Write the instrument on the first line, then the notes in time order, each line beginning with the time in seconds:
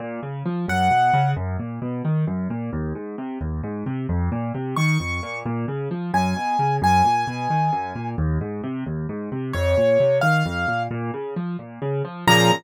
acoustic grand piano
0.00 A#2
0.23 C#3
0.46 F3
0.68 F#2 F#5
0.91 B2
1.14 C#3
1.36 F#2
1.59 A#2
1.82 B2
2.05 D#3
2.27 F#2
2.50 A#2
2.73 D#2
2.95 G#2
3.18 C3
3.41 D#2
3.64 G#2
3.86 C3
4.09 F2
4.32 A#2
4.54 C3
4.76 D#3 C#6
5.00 F2
5.23 A#2
5.46 A#2
5.68 C#3
5.91 F3
6.14 F#2 G#5
6.36 B2
6.59 C#3
6.82 F#2 G#5
7.05 A#2
7.27 B2
7.50 D#3
7.73 F#2
7.95 A#2
8.18 D#2
8.41 G#2
8.64 C3
8.86 D#2
9.09 G#2
9.32 C3
9.53 F2 C#5
9.77 A#2
10.00 C3
10.21 D#3 F5
10.46 F2
10.68 A#2
10.91 A#2
11.14 C#3
11.36 F3
11.59 A#2
11.82 C#3
12.05 F3
12.27 A#2 C#3 F3 A#5